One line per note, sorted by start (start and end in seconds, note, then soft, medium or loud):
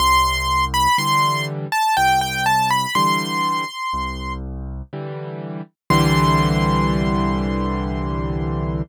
0.00 0.88 C2 loud
0.00 0.65 C6 loud
0.74 0.97 B5 loud
0.98 1.67 D3 medium
0.98 1.67 E3 medium
0.98 1.67 G3 medium
0.98 1.45 C6 loud
1.72 1.95 A5 loud
1.97 2.86 C2 medium
1.97 2.20 G5 loud
2.21 2.45 G5 loud
2.46 2.69 A5 loud
2.70 2.94 B5 loud
2.95 3.64 D3 medium
2.95 3.64 E3 medium
2.95 3.64 G3 medium
2.95 4.33 C6 loud
3.93 4.82 C2 medium
4.93 5.62 D3 medium
4.93 5.62 E3 medium
4.93 5.62 G3 medium
5.90 8.82 C2 loud
5.90 8.82 D3 loud
5.90 8.82 E3 loud
5.90 8.82 G3 loud
5.90 8.82 C6 loud